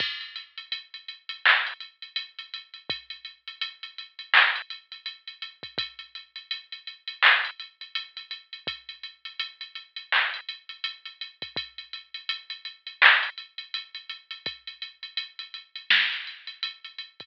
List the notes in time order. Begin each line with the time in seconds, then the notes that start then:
0.00 kick, crash
0.21 closed hi-hat
0.36 closed hi-hat
0.58 closed hi-hat
0.72 closed hi-hat
0.94 closed hi-hat
1.08 closed hi-hat
1.29 closed hi-hat
1.45 clap
1.67 closed hi-hat
1.80 closed hi-hat
2.02 closed hi-hat
2.16 closed hi-hat
2.39 closed hi-hat
2.54 closed hi-hat
2.74 closed hi-hat
2.90 kick, closed hi-hat
3.10 closed hi-hat
3.25 closed hi-hat
3.48 closed hi-hat
3.61 closed hi-hat
3.83 closed hi-hat
3.98 closed hi-hat
4.19 closed hi-hat
4.34 clap
4.55 closed hi-hat
4.70 closed hi-hat
4.92 closed hi-hat
5.06 closed hi-hat
5.27 closed hi-hat
5.42 closed hi-hat
5.63 kick, closed hi-hat
5.78 kick, closed hi-hat
5.99 closed hi-hat
6.15 closed hi-hat
6.36 closed hi-hat
6.51 closed hi-hat
6.72 closed hi-hat
6.87 closed hi-hat
7.08 closed hi-hat
7.23 clap
7.45 closed hi-hat
7.60 closed hi-hat
7.81 closed hi-hat
7.95 closed hi-hat
8.17 closed hi-hat
8.31 closed hi-hat
8.53 closed hi-hat
8.67 kick, closed hi-hat
8.89 closed hi-hat
9.03 closed hi-hat
9.25 closed hi-hat
9.39 closed hi-hat
9.61 closed hi-hat
9.75 closed hi-hat
9.96 closed hi-hat
10.12 clap
10.34 closed hi-hat
10.49 closed hi-hat
10.69 closed hi-hat
10.84 closed hi-hat
11.05 closed hi-hat
11.21 closed hi-hat
11.42 kick, closed hi-hat
11.56 kick, closed hi-hat
11.78 closed hi-hat
11.93 closed hi-hat
12.14 closed hi-hat
12.29 closed hi-hat
12.50 closed hi-hat
12.65 closed hi-hat
12.87 closed hi-hat
13.02 clap
13.23 closed hi-hat
13.38 closed hi-hat
13.58 closed hi-hat
13.74 closed hi-hat
13.95 closed hi-hat
14.09 closed hi-hat
14.31 closed hi-hat
14.46 kick, closed hi-hat
14.67 closed hi-hat
14.82 closed hi-hat
15.03 closed hi-hat
15.17 closed hi-hat
15.39 closed hi-hat
15.54 closed hi-hat
15.75 closed hi-hat
15.90 snare
16.12 closed hi-hat
16.27 closed hi-hat
16.47 closed hi-hat
16.63 closed hi-hat
16.84 closed hi-hat
16.98 closed hi-hat
17.20 kick, closed hi-hat